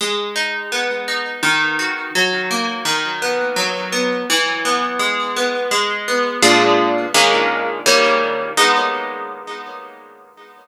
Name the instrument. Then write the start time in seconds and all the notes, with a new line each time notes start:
acoustic guitar (steel)
0.01 G#3
0.36 D#4
0.72 B3
1.08 D#4
1.43 D#3
1.79 F#4
2.15 F#3
2.51 A#3
2.85 D#3
3.22 B3
3.56 F#3
3.92 B3
4.30 E3
4.65 B3
4.99 G#3
5.36 B3
5.71 G#3
6.08 B3
6.42 A#2 G#3 D4 F4
7.14 D#3 G#3 A#3 C#4
7.86 D#3 G3 A#3 C#4
8.57 G#3 B3 D#4